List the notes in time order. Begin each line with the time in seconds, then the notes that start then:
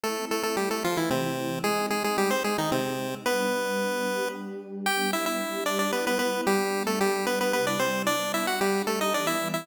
0.03 A3 C4 E4 A4
0.31 A3 A4
0.43 A3 A4
0.57 G3 G4
0.71 A3 A4
0.83 E3 F3 A3 E4 F4
0.97 E3 E4
1.10 C3 C4
1.64 G#3 C4 D#4 G#4
1.90 G#3 G#4
2.04 G#3 G#4
2.18 G3 G4
2.31 C4 C5
2.44 G#3 D#4 G#4
2.58 D#3 D#4
2.72 C3 C4
3.25 G3 B3 D4 B4
4.06 G3 D4 G4
4.86 G3 B3 D4 G4 G5
5.13 E4 E5
5.26 E4 E5
5.40 G3 D4 G4
5.66 D4 D5
5.79 D4 D5
5.93 G3 B3 E4 B4
6.07 B3 B4
6.19 B3 B4
6.47 G3 B3 D4 G4
6.87 A3 A4
7.00 G3 D4 G4
7.26 B3 B4
7.41 B3 B4
7.53 C3 G3 B3 E4 B4
7.67 D4 D5
7.79 C4 C5
8.07 G3 B3 D4 D5
8.34 E4 E5
8.47 F#4 F#5
8.60 G3 D4 G4
8.87 A3 A4
9.01 D#4 D#5
9.14 E3 G3 B3 D4 D5
9.27 E4 E5
9.54 E4 E5